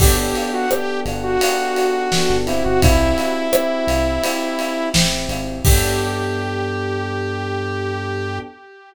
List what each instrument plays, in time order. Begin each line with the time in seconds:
0.00 synth bass 1 G1, electric piano 1 B3 D4 G4 A4, lead 2 (sawtooth) G4, kick, crash
0.18 lead 2 (sawtooth) G4
0.35 lead 2 (sawtooth) G4, ride
0.53 lead 2 (sawtooth) F#4
0.70 electric piano 1 B3 D4 G4 A4, lead 2 (sawtooth) G4, cross-stick
1.05 synth bass 1 G1, ride
1.23 lead 2 (sawtooth) F#4
1.41 electric piano 1 B3 D4 G4 A4, ride
1.76 ride
2.12 electric piano 1 B3 D4 G4 A4, snare
2.30 synth bass 1 G1
2.46 electric piano 1 C4 E4 G4, lead 2 (sawtooth) E4, ride
2.64 synth bass 1 G1, lead 2 (sawtooth) F#4
2.82 synth bass 1 C2, lead 2 (sawtooth) E4, kick, ride
3.18 ride
3.53 electric piano 1 C4 E4 G4, cross-stick
3.87 synth bass 1 C2, ride
4.23 electric piano 1 C4 E4 G4, ride
4.59 ride
4.94 synth bass 1 A1, electric piano 1 C4 E4 G4, snare
5.29 synth bass 1 G#1, ride
5.65 synth bass 1 G2, electric piano 1 B3 D4 G4 A4, lead 2 (sawtooth) G4, kick, crash